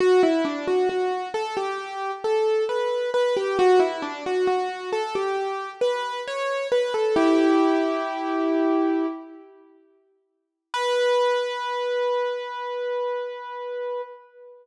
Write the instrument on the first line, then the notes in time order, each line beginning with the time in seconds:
acoustic grand piano
0.00 F#4
0.23 E4
0.45 D4
0.68 F#4
0.89 F#4
1.34 A4
1.57 G4
2.24 A4
2.69 B4
3.14 B4
3.37 G4
3.59 F#4
3.79 E4
4.02 D4
4.26 F#4
4.47 F#4
4.93 A4
5.15 G4
5.81 B4
6.28 C#5
6.72 B4
6.94 A4
7.16 E4 G4
10.74 B4